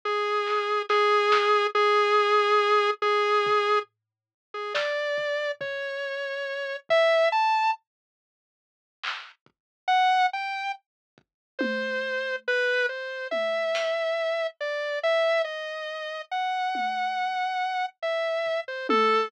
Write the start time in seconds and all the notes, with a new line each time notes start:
0.05 G#4
0.46 clap
0.89 G#4, snare
1.32 snare
1.75 G#4
3.02 G#4
3.46 floor tom
4.54 G#4
4.74 D5, snare
5.18 floor tom
5.61 C#5, floor tom
6.89 E5, floor tom
7.32 A5
9.04 clap
9.46 kick
9.88 F#5
10.33 G5
11.18 kick
11.59 C5, high tom
12.48 B4
12.89 C5
13.31 E5, high tom
13.75 closed hi-hat
14.61 D5
15.03 E5
15.44 D#5
16.31 F#5
16.75 high tom
18.03 E5
18.46 floor tom
18.68 C5
18.89 A4, high tom